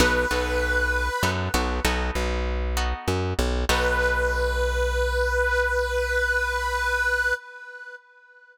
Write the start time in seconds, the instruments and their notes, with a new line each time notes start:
0.00 electric bass (finger) B1, acoustic guitar (steel) B3 D#4 F#4 A4, harmonica B4
0.31 electric bass (finger) B1, acoustic guitar (steel) B3 D#4 F#4 A4
1.23 electric bass (finger) F#2, acoustic guitar (steel) B3 D#4 F#4 A4
1.54 electric bass (finger) B1, acoustic guitar (steel) B3 D#4 F#4 A4
1.85 electric bass (finger) B1, acoustic guitar (steel) B3 D#4 F#4 A4
2.15 electric bass (finger) B1
2.77 acoustic guitar (steel) B3 D#4 F#4 A4
3.08 electric bass (finger) F#2
3.39 electric bass (finger) B1
3.69 electric bass (finger) B1, acoustic guitar (steel) B3 D#4 F#4 A4, harmonica B4